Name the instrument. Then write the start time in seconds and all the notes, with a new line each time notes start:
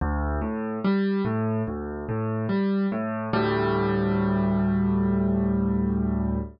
acoustic grand piano
0.01 D2
0.41 A2
0.84 G3
1.25 A2
1.67 D2
2.09 A2
2.49 G3
2.92 A2
3.33 D2 A2 G3